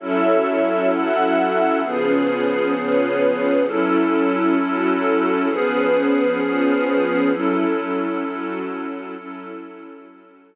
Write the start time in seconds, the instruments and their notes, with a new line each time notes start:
0.00 pad 2 (warm) F#3 C#4 E4 A4, string ensemble 1 F#4 A4 C#5 E5
0.91 string ensemble 1 F#4 A4 E5 F#5
1.83 pad 2 (warm) C#3 F3 B3 G#4, string ensemble 1 C#4 F4 G#4 B4
2.75 string ensemble 1 C#4 F4 B4 C#5
3.66 pad 2 (warm) F#3 C#4 E4 A4, string ensemble 1 F#3 C#4 E4 A4
4.58 string ensemble 1 F#3 C#4 F#4 A4
5.49 string ensemble 1 F3 C#4 G#4 B4, pad 2 (warm) F3 B3 C#4 G#4
6.42 string ensemble 1 F3 C#4 F4 B4
7.33 pad 2 (warm) F#3 C#4 E4 A4, string ensemble 1 F#3 C#4 E4 A4
8.25 string ensemble 1 F#3 C#4 F#4 A4
9.16 pad 2 (warm) F#3 C#4 E4 A4, string ensemble 1 F#3 C#4 E4 A4
10.07 string ensemble 1 F#3 C#4 F#4 A4